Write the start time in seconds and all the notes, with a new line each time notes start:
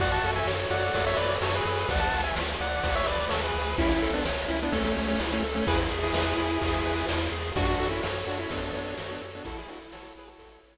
0.00 F#2 F#4 D5 F#5, kick, ride
0.12 F#5 A5
0.24 F#2 A4, ride
0.36 E5 G#5
0.46 F#2 C#5, snare
0.70 F#2 F#4 D5 F#5, ride
0.94 F#2 A4, kick, ride
1.06 C#5 E5
1.17 F#2 B4 C#5 D5, ride
1.41 F#2 F#4 A4 C#5, snare
1.55 G#4 B4
1.65 F#2 A4, ride
1.89 D2 D5 F#5, kick, ride
1.99 F#5 A5
2.12 D2, ride
2.24 E5 G#5
2.35 D2, snare
2.60 D2 D5 F#5, ride
2.83 D2, kick, ride
2.95 C#5 E5
3.06 D2 B4 D5, ride
3.29 D#2 A4 C#5, snare
3.44 G#4 B4
3.54 D2, ride
3.78 C#2 C#4 E4, kick, ride
3.89 C#4 E4
4.02 C#2 A4, ride
4.13 B3 D4
4.25 C#2 C#5, snare
4.48 C#2 C#4 E4, ride
4.63 B3 D4
4.72 C#2 A3 C#4 A4, kick, ride
4.84 A3 C#4
4.96 C#2 A3 C#4 C#5, ride
5.08 A3 C#4
5.20 C#2 E4, snare
5.32 A3 C#4
5.43 C#2 A4, ride
5.55 A3 C#4
5.67 E2 E4 G#4 B4, kick, ride
5.91 E2 G#4, ride
6.03 E4 G#4
6.14 E2 E4 G#4 B4, snare
6.37 E2 E4, ride
6.61 E2 G#4, kick, ride
6.84 E2 B4, ride
7.09 E2 E4, snare
7.32 E2 G#4, ride
7.56 F#2 D4 F#4, kick, ride
7.67 D4 F#4
7.79 F#2 A4, ride
7.90 C#4 E4
8.03 F#2 C#5, snare
8.26 F#2 D4 F#4, ride
8.39 C#4 E4
8.50 F#2 B3 D4 A4, kick, ride
8.62 B3 D4
8.73 F#2 B3 D4 C#5, ride
8.85 B3 D4
8.98 F#2 F#4, snare
9.11 B3 D4
9.21 F#2 A4, ride
9.35 B3 D4
9.45 A1 E4 F#4 A4, kick, ride
9.58 E4 G#4
9.68 A1 D4 F#4 A4, ride
9.92 A1 F#4 A4 C#5, snare
10.15 A1 E4 G#4 B4, ride
10.27 F#4 A4
10.38 A1 A4, kick, ride
10.63 A1 C#5, ride